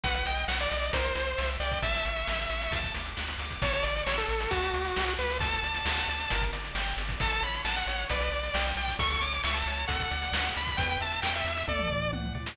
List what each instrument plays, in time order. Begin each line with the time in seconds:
0.03 synth bass 1 B1, lead 1 (square) B4 F#5, kick, closed hi-hat
0.14 lead 1 (square) F#5, closed hi-hat
0.26 synth bass 1 B1, lead 1 (square) D#5 G5, closed hi-hat
0.37 closed hi-hat
0.48 synth bass 1 B1, lead 1 (square) F#5, snare
0.60 lead 1 (square) D5, closed hi-hat
0.71 synth bass 1 B1, lead 1 (square) D#5, closed hi-hat
0.82 closed hi-hat
0.93 synth bass 1 C2, lead 1 (square) A#4 C5, kick, closed hi-hat
1.04 closed hi-hat
1.15 synth bass 1 C2, lead 1 (square) C5, closed hi-hat
1.27 closed hi-hat
1.38 synth bass 1 C2, lead 1 (square) E5, snare
1.49 closed hi-hat
1.60 synth bass 1 C2, lead 1 (square) D5 G5, closed hi-hat
1.71 kick, closed hi-hat
1.82 synth bass 1 A1, lead 1 (square) E5 A5, kick, closed hi-hat
1.94 closed hi-hat
2.05 synth bass 1 A1, lead 1 (square) C#6, closed hi-hat
2.16 closed hi-hat
2.27 synth bass 1 A1, lead 1 (square) E6, snare
2.39 closed hi-hat
2.50 synth bass 1 A1, lead 1 (square) C#6, closed hi-hat
2.61 closed hi-hat
2.71 synth bass 1 D2, lead 1 (square) A5, kick, closed hi-hat
2.83 kick, closed hi-hat
2.94 synth bass 1 D2, lead 1 (square) D6, closed hi-hat
3.06 closed hi-hat
3.17 synth bass 1 D2, lead 1 (square) F#6, snare
3.28 closed hi-hat
3.38 synth bass 1 D2, lead 1 (square) D6, closed hi-hat
3.50 kick, closed hi-hat
3.62 synth bass 1 A1, lead 1 (square) C#5 A5, kick, closed hi-hat
3.73 lead 1 (square) C#5, closed hi-hat
3.83 synth bass 1 A1, lead 1 (square) D5 C#6, closed hi-hat
3.96 closed hi-hat
4.06 synth bass 1 A1, lead 1 (square) C#5 E6, snare
4.18 lead 1 (square) A4, closed hi-hat
4.28 synth bass 1 A1, lead 1 (square) C#6, closed hi-hat
4.40 closed hi-hat
4.51 synth bass 1 D2, lead 1 (square) F#4 A5, kick, closed hi-hat
4.62 closed hi-hat
4.74 synth bass 1 D2, lead 1 (square) D6, closed hi-hat
4.85 closed hi-hat
4.96 synth bass 1 C2, lead 1 (square) F#6, snare
5.07 closed hi-hat
5.19 synth bass 1 C#2, lead 1 (square) B4 D6, closed hi-hat
5.30 open hi-hat
5.40 synth bass 1 D2, lead 1 (square) A4 A5, kick, closed hi-hat
5.52 closed hi-hat
5.63 synth bass 1 D2, lead 1 (square) D5, closed hi-hat
5.74 closed hi-hat
5.85 synth bass 1 D2, lead 1 (square) F#5, snare
5.97 closed hi-hat
6.08 synth bass 1 D2, lead 1 (square) D5, closed hi-hat
6.19 closed hi-hat
6.30 synth bass 1 G1, lead 1 (square) A#4, kick, closed hi-hat
6.42 kick, closed hi-hat
6.52 synth bass 1 G1, lead 1 (square) D5, closed hi-hat
6.64 closed hi-hat
6.75 synth bass 1 G1, lead 1 (square) G5, snare
6.87 closed hi-hat
6.97 synth bass 1 G1, lead 1 (square) D5, closed hi-hat
7.09 kick, closed hi-hat
7.20 synth bass 1 A1, lead 1 (square) A4 A5, kick, closed hi-hat
7.31 lead 1 (square) A5, closed hi-hat
7.42 synth bass 1 A1, lead 1 (square) C#5 B5, closed hi-hat
7.54 closed hi-hat
7.64 synth bass 1 A1, lead 1 (square) F#5 A5, snare
7.76 lead 1 (square) F#5, closed hi-hat
7.87 synth bass 1 A1, lead 1 (square) C#5, closed hi-hat
7.98 closed hi-hat
8.09 synth bass 1 B1, lead 1 (square) B4 D5, kick, closed hi-hat
8.20 closed hi-hat
8.31 synth bass 1 B1, lead 1 (square) D5, closed hi-hat
8.43 closed hi-hat
8.54 synth bass 1 B1, lead 1 (square) G5, snare
8.66 closed hi-hat
8.76 synth bass 1 B1, lead 1 (square) D5 G5, closed hi-hat
8.88 kick, closed hi-hat
8.99 synth bass 1 C#2, lead 1 (square) A4 C#6, kick, closed hi-hat
9.10 lead 1 (square) C#6, closed hi-hat
9.21 synth bass 1 C#2, lead 1 (square) C#5 D6, closed hi-hat
9.33 closed hi-hat
9.44 synth bass 1 C#2, lead 1 (square) E5 C#6, snare
9.54 lead 1 (square) A5, closed hi-hat
9.66 synth bass 1 C#2, lead 1 (square) C#5, closed hi-hat
9.77 closed hi-hat
9.87 synth bass 1 D2, lead 1 (square) A4 F#5, kick, closed hi-hat
10.00 kick, closed hi-hat
10.11 synth bass 1 D2, lead 1 (square) D5, closed hi-hat
10.22 closed hi-hat
10.33 synth bass 1 D2, lead 1 (square) F#5, snare
10.44 closed hi-hat
10.56 synth bass 1 D2, lead 1 (square) D5 B5, closed hi-hat
10.67 kick, closed hi-hat
10.77 synth bass 1 E2, lead 1 (square) B4 G5, kick, closed hi-hat
10.89 lead 1 (square) G5, closed hi-hat
11.00 synth bass 1 E2, lead 1 (square) E5 A5, closed hi-hat
11.12 closed hi-hat
11.22 synth bass 1 E2, lead 1 (square) G5, snare
11.34 lead 1 (square) E5, closed hi-hat
11.45 synth bass 1 E2, lead 1 (square) E5, closed hi-hat
11.57 closed hi-hat
11.68 synth bass 1 D2, lead 1 (square) A4 D5, kick, high tom
11.79 mid tom
11.90 synth bass 1 D2, lead 1 (square) D5, floor tom
12.13 synth bass 1 C#2, lead 1 (square) F#5, high tom
12.24 mid tom
12.35 synth bass 1 D2, lead 1 (square) D5, floor tom
12.46 snare